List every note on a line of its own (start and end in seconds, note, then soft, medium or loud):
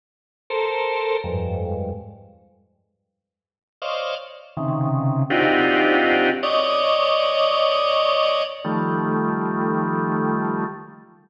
0.50 1.17 A4 medium
0.50 1.17 A#4 medium
0.50 1.17 C5 medium
1.24 1.91 F2 medium
1.24 1.91 G2 medium
1.24 1.91 G#2 medium
3.82 4.15 C5 medium
3.82 4.15 C#5 medium
3.82 4.15 D5 medium
3.82 4.15 D#5 medium
3.82 4.15 F5 medium
4.57 5.23 C3 medium
4.57 5.23 C#3 medium
4.57 5.23 D#3 medium
5.30 6.30 C4 medium
5.30 6.30 D4 medium
5.30 6.30 D#4 medium
5.30 6.30 F4 medium
5.30 6.30 F#4 medium
5.30 6.30 G4 medium
6.43 8.43 C#5 loud
6.43 8.43 D5 loud
6.43 8.43 D#5 loud
8.64 10.64 D#3 medium
8.64 10.64 F3 medium
8.64 10.64 G3 medium
8.64 10.64 A3 medium